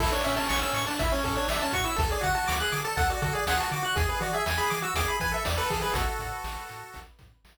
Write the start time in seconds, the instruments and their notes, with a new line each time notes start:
0.00 synth bass 1 A1, lead 1 (square) E4 A4, kick, crash
0.12 lead 1 (square) D4 C#5
0.24 synth bass 1 A2, lead 1 (square) C#4 E5, closed hi-hat
0.36 lead 1 (square) C#4 A5
0.49 synth bass 1 A1, lead 1 (square) C#6, snare
0.62 lead 1 (square) C#4 E6
0.73 synth bass 1 A2, lead 1 (square) C#6, snare, closed hi-hat
0.87 lead 1 (square) D4 A5
0.99 synth bass 1 A1, lead 1 (square) E4 E5, kick, closed hi-hat
1.12 lead 1 (square) C#4 C#5
1.24 synth bass 1 A2, lead 1 (square) C#4 A4, kick, closed hi-hat
1.36 lead 1 (square) D4 C#5
1.48 synth bass 1 A1, lead 1 (square) D4 E5, snare
1.62 lead 1 (square) C#4 A5
1.73 synth bass 1 A2, lead 1 (square) F#4 C#6, kick, closed hi-hat
1.84 lead 1 (square) E4 E6
1.96 synth bass 1 D2, lead 1 (square) A4, kick, closed hi-hat
2.10 lead 1 (square) G#4 D5
2.21 synth bass 1 D3, lead 1 (square) F#4 F#5, kick, closed hi-hat
2.35 lead 1 (square) F#4 A5
2.48 synth bass 1 D2, lead 1 (square) D6, snare
2.60 lead 1 (square) G#4 F#6
2.72 synth bass 1 D3, lead 1 (square) D6, snare, closed hi-hat
2.85 lead 1 (square) A4 A5
2.97 synth bass 1 D2, lead 1 (square) A4 F#5, kick, closed hi-hat
3.10 lead 1 (square) F#4 D5
3.22 synth bass 1 D3, lead 1 (square) F#4 A4, kick, closed hi-hat
3.33 lead 1 (square) G#4 D5
3.46 synth bass 1 D2, lead 1 (square) G#4 F#5, snare
3.58 lead 1 (square) F#4 A5
3.71 synth bass 1 D3, lead 1 (square) F#4 D6, closed hi-hat
3.83 lead 1 (square) F#4 F#6
3.96 synth bass 1 E2, lead 1 (square) G#4, kick, closed hi-hat
4.09 lead 1 (square) B4
4.20 synth bass 1 E3, lead 1 (square) F#4 D5, closed hi-hat
4.33 lead 1 (square) G#4 E5
4.46 synth bass 1 E2, lead 1 (square) G#5, snare
4.58 lead 1 (square) G#4 B5
4.70 synth bass 1 E3, lead 1 (square) D6, snare, closed hi-hat
4.82 lead 1 (square) F#4 E6
4.94 synth bass 1 E2, lead 1 (square) G#4 D6, kick, closed hi-hat
5.08 lead 1 (square) B5
5.20 synth bass 1 E3, lead 1 (square) B4 G#5, kick, closed hi-hat
5.32 lead 1 (square) A4 E5
5.45 synth bass 1 E2, lead 1 (square) D5, snare
5.57 lead 1 (square) A4 B4
5.70 synth bass 1 E3, lead 1 (square) G#4, kick, open hi-hat
5.81 lead 1 (square) G#4 B4
5.93 synth bass 1 A1, lead 1 (square) F#4 A4, kick, closed hi-hat
6.19 synth bass 1 A2, kick, closed hi-hat
6.44 synth bass 1 A1, snare
6.69 synth bass 1 A2, snare, closed hi-hat
6.94 synth bass 1 A1, kick, closed hi-hat
7.19 synth bass 1 A2, kick, closed hi-hat
7.44 synth bass 1 A1, snare